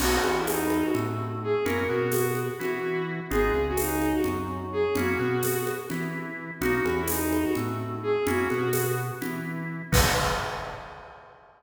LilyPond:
<<
  \new Staff \with { instrumentName = "Violin" } { \time 7/8 \key b \major \tempo 4 = 127 fis'8. e'16 dis'8. fis'16 r4 gis'8 | ais'8 fis'8 fis'8 r8 fis'4 r8 | gis'8. fis'16 dis'8. fis'16 r4 gis'8 | fis'4. r2 |
fis'8. e'16 dis'8. fis'16 r4 gis'8 | fis'4. r2 | b'4 r2 r8 | }
  \new Staff \with { instrumentName = "Drawbar Organ" } { \time 7/8 \key b \major <ais b dis' fis'>8 e4. a4. | <ais cis' e' fis'>8 b4. e'4. | <gis b dis' eis'>8 cis4. fis4. | <ais cis' e' fis'>8 b4. e'4. |
<ais b dis' fis'>8 e4. a4. | <ais cis' e' fis'>8 b4. e'4. | <ais b dis' fis'>4 r2 r8 | }
  \new Staff \with { instrumentName = "Synth Bass 1" } { \clef bass \time 7/8 \key b \major b,,8 e,4. a,4. | fis,8 b,4. e4. | gis,,8 cis,4. fis,4. | fis,8 b,4. e4. |
b,,8 e,4. a,4. | fis,8 b,4. e4. | b,,4 r2 r8 | }
  \new DrumStaff \with { instrumentName = "Drums" } \drummode { \time 7/8 <cgl cymc>8 cgho8 <cgho tamb>8 cgho8 cgl4. | cgl4 <cgho tamb>8 cgho8 cgl4. | cgl4 <cgho tamb>8 cgho8 cgl4. | cgl4 <cgho tamb>8 cgho8 cgl4. |
cgl8 cgho8 <cgho tamb>8 cgho8 cgl4. | cgl8 cgho8 <cgho tamb>4 cgl4. | <cymc bd>4 r4 r4. | }
>>